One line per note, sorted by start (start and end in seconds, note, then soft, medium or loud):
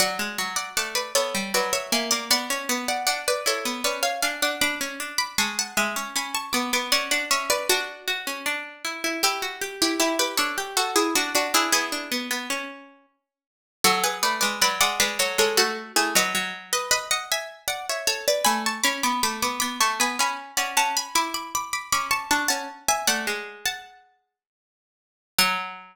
0.00 0.18 F#3 medium
0.00 0.51 D5 medium
0.00 0.51 F#5 medium
0.19 0.37 G#3 medium
0.38 0.69 F#3 medium
0.56 0.74 D5 medium
0.56 0.74 F#5 medium
0.77 1.13 A3 medium
0.77 0.95 D5 medium
0.77 0.95 F#5 medium
0.95 1.13 B4 medium
0.95 1.13 D5 medium
1.15 1.34 B3 medium
1.15 1.51 A4 medium
1.15 1.51 C#5 medium
1.34 1.53 G3 medium
1.54 1.91 F#3 medium
1.54 1.73 B4 medium
1.54 1.73 D5 medium
1.73 1.91 C#5 medium
1.73 1.91 E5 medium
1.92 2.11 A#3 medium
1.92 2.11 E5 medium
1.92 2.11 G#5 medium
2.11 2.30 A#3 medium
2.11 2.29 D5 medium
2.11 2.29 F#5 medium
2.30 2.49 B3 medium
2.30 2.85 D5 medium
2.30 2.85 F#5 loud
2.50 2.68 C#4 medium
2.69 3.06 B3 medium
2.88 3.06 D5 medium
2.88 3.06 F#5 medium
3.07 3.41 D4 medium
3.07 3.25 D5 medium
3.07 3.25 F#5 medium
3.28 3.46 B4 medium
3.28 3.46 D5 medium
3.46 3.64 E4 medium
3.46 3.80 A4 medium
3.46 3.80 C#5 medium
3.65 3.84 B3 medium
3.84 4.22 C#4 medium
3.84 4.03 B4 medium
3.84 4.03 D5 medium
4.03 4.21 C#5 medium
4.03 4.21 F5 medium
4.22 4.41 D4 medium
4.22 4.41 F5 medium
4.22 4.41 G#5 medium
4.42 4.61 D4 medium
4.42 4.61 D5 medium
4.42 4.61 F#5 medium
4.61 4.80 D4 medium
4.61 5.11 B5 medium
4.61 5.11 D6 loud
4.81 4.99 C#4 medium
5.00 5.37 D4 medium
5.18 5.37 B5 medium
5.18 5.37 D6 medium
5.38 5.74 G#3 medium
5.38 5.56 A5 medium
5.38 5.56 C#6 medium
5.59 5.77 F#5 medium
5.59 5.77 A5 medium
5.77 5.95 G#3 medium
5.77 6.13 E5 medium
5.77 6.13 G#5 medium
5.96 6.14 C#4 medium
6.16 6.51 C#4 medium
6.16 6.35 G#5 medium
6.16 6.35 B5 medium
6.34 6.53 A5 medium
6.34 6.53 C#6 medium
6.53 6.72 B3 medium
6.53 6.71 B5 medium
6.53 6.71 D6 medium
6.73 6.92 B3 medium
6.73 6.91 B5 medium
6.73 6.91 D6 medium
6.92 7.11 C#4 medium
6.92 7.10 D5 medium
6.92 7.10 F#5 loud
7.11 7.30 D4 medium
7.11 7.29 D5 medium
7.11 7.29 F#5 medium
7.31 7.67 C#4 medium
7.31 7.49 C#5 medium
7.31 7.49 E5 medium
7.50 7.68 B4 medium
7.50 7.68 D5 medium
7.69 8.41 D4 medium
7.69 8.01 F#4 medium
7.69 8.41 F#4 medium
8.08 8.26 F#4 medium
8.27 8.45 C#4 medium
8.46 8.83 D4 medium
8.85 9.03 E4 medium
9.04 9.22 E4 medium
9.23 9.76 E4 medium
9.23 9.41 G4 medium
9.23 9.76 G4 medium
9.42 9.61 F#4 medium
9.61 9.98 G4 medium
9.82 9.99 E4 medium
9.82 9.99 G4 medium
10.00 10.18 E4 medium
10.00 10.34 E4 medium
10.00 10.18 G4 medium
10.19 10.38 G4 medium
10.19 10.38 B4 medium
10.37 10.57 D4 medium
10.37 10.72 A4 medium
10.37 10.72 C#5 medium
10.58 10.76 G4 medium
10.77 10.95 F#4 medium
10.77 11.09 F#4 medium
10.77 10.95 A4 medium
10.96 11.14 E4 medium
10.96 11.14 G#4 medium
11.15 11.34 D4 medium
11.15 11.34 F#4 medium
11.35 11.53 D4 medium
11.35 11.54 D4 medium
11.35 11.54 F#4 medium
11.54 11.72 D4 medium
11.54 11.72 E4 medium
11.54 11.72 G#4 medium
11.72 11.91 B3 medium
11.72 12.90 E4 medium
11.72 12.90 G#4 medium
11.92 12.10 D4 medium
12.12 12.30 B3 medium
12.31 12.49 B3 medium
12.50 13.06 C#4 medium
13.84 14.21 F#3 medium
13.84 14.03 F#4 medium
13.84 14.03 A4 loud
14.04 14.22 G#4 medium
14.04 14.22 B4 medium
14.23 14.41 A3 medium
14.23 14.40 B4 medium
14.23 14.40 D5 medium
14.41 14.61 G#3 medium
14.41 14.59 B4 medium
14.41 14.59 D5 medium
14.62 14.80 F#3 medium
14.62 14.80 B4 medium
14.62 14.80 D5 loud
14.80 14.99 G#3 medium
14.80 14.99 D5 medium
14.80 14.99 F#5 loud
15.00 15.18 G#3 medium
15.00 15.18 B4 medium
15.00 15.18 D5 medium
15.19 15.37 F#3 medium
15.19 15.38 A4 medium
15.19 15.38 C#5 medium
15.38 15.57 G#3 medium
15.38 15.57 A4 medium
15.38 15.57 C#5 medium
15.57 15.92 A3 medium
15.57 15.92 F#4 medium
15.57 15.92 A4 medium
15.96 16.14 A3 medium
15.96 16.14 E4 medium
15.96 16.14 G#4 medium
16.15 16.34 F#3 medium
16.15 16.68 B4 medium
16.15 16.68 D#5 loud
16.35 17.82 F#3 medium
16.73 16.91 B4 medium
16.73 16.91 D#5 medium
16.91 17.09 B4 medium
16.91 17.09 D#5 medium
17.11 17.29 D#5 medium
17.11 17.29 F#5 medium
17.32 17.63 E5 medium
17.32 17.63 G#5 medium
17.68 17.86 D5 medium
17.68 17.86 F#5 medium
17.89 18.07 C#5 medium
17.89 18.08 E5 medium
18.07 18.25 A4 medium
18.07 18.25 C#5 medium
18.28 18.46 B4 medium
18.28 18.46 D5 medium
18.45 18.81 A3 medium
18.45 18.63 G#5 loud
18.45 18.63 B5 loud
18.66 18.84 A5 medium
18.66 18.84 C#6 medium
18.83 19.03 C#4 medium
18.83 19.02 B5 medium
18.83 19.02 D6 loud
19.03 19.22 B3 medium
19.03 19.22 B5 medium
19.03 19.22 D6 medium
19.23 19.41 A3 medium
19.23 19.41 B5 medium
19.23 19.41 D6 medium
19.42 19.61 B3 medium
19.42 19.59 B5 medium
19.42 19.59 D6 medium
19.60 19.80 B3 medium
19.60 19.78 B5 medium
19.60 19.78 D6 medium
19.80 19.99 A3 medium
19.80 19.99 A5 medium
19.80 19.99 C#6 medium
20.00 20.18 B3 medium
20.00 20.19 G#5 medium
20.00 20.19 B5 medium
20.19 20.51 C#4 medium
20.19 20.54 G#5 medium
20.19 20.54 B5 medium
20.57 20.76 C#4 medium
20.57 20.75 D5 medium
20.57 20.75 F#5 medium
20.77 21.08 C#4 medium
20.77 20.96 F#5 medium
20.77 20.96 A5 loud
20.97 21.15 G#5 medium
20.97 21.15 B5 medium
21.15 21.87 E4 medium
21.15 21.34 B5 medium
21.15 21.34 D6 medium
21.34 21.53 B5 medium
21.34 21.53 D6 medium
21.55 21.73 B5 medium
21.55 21.73 D6 medium
21.73 21.91 B5 medium
21.73 21.91 D6 medium
21.92 22.26 C#4 medium
21.92 22.11 B5 medium
21.92 22.11 D6 medium
22.11 22.29 A5 medium
22.11 22.29 C#6 medium
22.31 22.49 D4 medium
22.31 22.48 A5 medium
22.31 22.49 C#6 medium
22.48 22.68 C#4 medium
22.48 22.84 F#5 medium
22.48 22.84 A5 medium
22.88 23.07 E5 medium
22.88 23.07 G#5 medium
23.07 23.26 A3 medium
23.07 23.59 D5 medium
23.07 23.59 F#5 medium
23.27 24.36 G#3 medium
23.66 24.45 F#5 medium
23.66 24.45 A5 medium
25.38 25.96 F#3 loud
25.38 25.96 F#5 loud